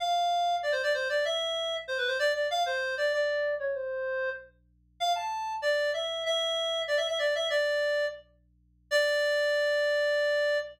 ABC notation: X:1
M:4/4
L:1/8
Q:1/4=192
K:Ddor
V:1 name="Clarinet"
f4 (3d c d c d | e4 (3c B c d d | f c2 d d3 _d | c4 z4 |
f a3 d2 e2 | e4 (3d e e d e | "^rit." d4 z4 | d8 |]